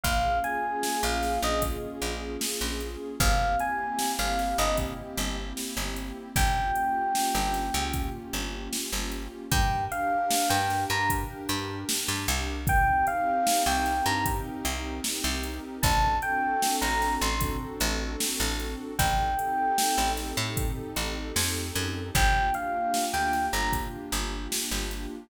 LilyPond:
<<
  \new Staff \with { instrumentName = "Electric Piano 1" } { \time 4/4 \key f \minor \tempo 4 = 76 f''8 aes''8. f''8 ees''16 r2 | f''8 aes''8. f''8 ees''16 r2 | g''2 r2 | \key g \minor g''8 f''8. g''8 bes''16 r2 |
g''8 f''8. g''8 bes''16 r2 | a''8 g''8. bes''8 c'''16 r2 | g''4. r2 r8 | g''8 f''8. g''8 bes''16 r2 | }
  \new Staff \with { instrumentName = "Pad 2 (warm)" } { \time 4/4 \key f \minor <bes des' f' aes'>1 | <bes c' e' g'>1 | <bes des' f' g'>1 | \key g \minor <d' g' bes'>1 |
<c' ees' g' bes'>1 | <c' d' fis' a'>1 | <c' ees' g' a'>1 | <bes d' f' g'>1 | }
  \new Staff \with { instrumentName = "Electric Bass (finger)" } { \clef bass \time 4/4 \key f \minor bes,,4~ bes,,16 bes,,8 bes,,8. bes,,8. bes,,8. | g,,4~ g,,16 g,,8 g,,8. g,,8. g,,8. | g,,4~ g,,16 g,,8 des,8. g,,8. g,,8. | \key g \minor g,4~ g,16 g,8 g,8. g,8. g,16 c,8~ |
c,4~ c,16 c,8 g,8. c,8. c,8. | a,,4~ a,,16 a,,8 a,,8. a,,8. a,,8. | a,,4~ a,,16 a,,8 a,8. a,,8 f,8 fis,8 | g,,4~ g,,16 d,8 g,,8. g,,8. g,,8. | }
  \new DrumStaff \with { instrumentName = "Drums" } \drummode { \time 4/4 <hh bd>8 hh8 sn8 <hh sn>8 <hh bd>8 hh8 sn8 hh8 | <hh bd>8 hh8 sn8 <hh sn>8 <hh bd>8 hh8 sn8 hh8 | <hh bd>8 hh8 sn8 <hh sn>8 <hh bd>8 hh8 sn8 hh8 | <hh bd>8 hh8 sn8 <hh sn>8 <hh bd>8 hh8 sn8 hh8 |
<hh bd>8 hh8 sn8 <hh sn>8 <hh bd>8 hh8 sn8 hh8 | <hh bd>8 hh8 sn8 <hh sn>8 <hh bd>8 hh8 sn8 <hh sn>8 | <hh bd>8 hh8 sn8 <hh sn>8 <hh bd>8 hh8 sn8 hh8 | <hh bd>8 hh8 sn8 <hh sn>8 <hh bd>8 hh8 sn8 hh8 | }
>>